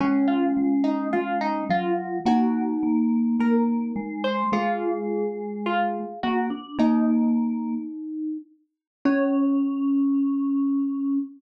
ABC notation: X:1
M:2/2
L:1/8
Q:1/2=53
K:Db
V:1 name="Xylophone"
[Dd] [Ff]2 [Ee] [Ff] [Ee] [Ff]2 | [Gg]4 [Bb]3 [cc'] | [Ff]4 [Ff]2 [Gg] z | [Ee]7 z |
d8 |]
V:2 name="Glockenspiel"
D8 | E8 | A8 | E7 z |
D8 |]
V:3 name="Vibraphone"
A,2 A,2 A,2 G,2 | B,2 B,2 B,2 A,2 | A,6 B, =D | B,4 z4 |
D8 |]